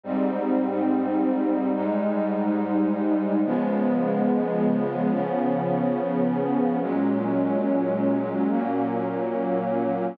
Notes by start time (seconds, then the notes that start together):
0.04 G#2 G3 C4 D#4
1.74 G#2 G3 G#3 D#4
3.45 C#3 F3 G#3 B3
5.11 C#3 F3 B3 C#4
6.81 A#2 F#3 G#3 C#4
8.49 A#2 F#3 A#3 C#4